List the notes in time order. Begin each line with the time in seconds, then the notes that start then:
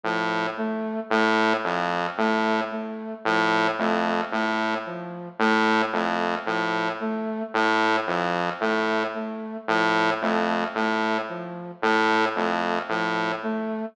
0.04 A2 F3
0.57 A3
1.10 A2 A3
1.64 F2 F3
2.18 A2 A3
2.71 A3
3.25 A2 F3
3.78 F2 A3
4.32 A2 A3
4.86 F3
5.39 A2 A3
5.93 F2 A3
6.46 A2 F3
7.00 A3
7.54 A2 A3
8.07 F2 F3
8.60 A2 A3
9.14 A3
9.68 A2 F3
10.21 F2 A3
10.75 A2 A3
11.29 F3
11.82 A2 A3
12.36 F2 A3
12.89 A2 F3
13.43 A3